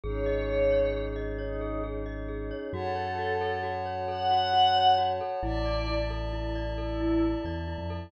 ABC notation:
X:1
M:6/8
L:1/16
Q:3/8=89
K:Fm
V:1 name="Pad 5 (bowed)"
d8 z4 | E4 z8 | [K:F#m] A8 z4 | f8 z4 |
d4 z8 | E4 z8 |]
V:2 name="Glockenspiel"
A2 e2 A2 d2 A2 e2 | d2 A2 A2 e2 A2 d2 | [K:F#m] F2 c2 F2 A2 F2 c2 | A2 F2 F2 c2 F2 A2 |
E2 d2 E2 A2 E2 d2 | A2 E2 E2 d2 E2 A2 |]
V:3 name="Synth Bass 2" clef=bass
A,,,12- | A,,,12 | [K:F#m] F,,12- | F,,12 |
A,,,12- | A,,,6 E,,3 ^E,,3 |]
V:4 name="Pad 5 (bowed)"
[DEA]12- | [DEA]12 | [K:F#m] [cfa]12- | [cfa]12 |
[dea]12- | [dea]12 |]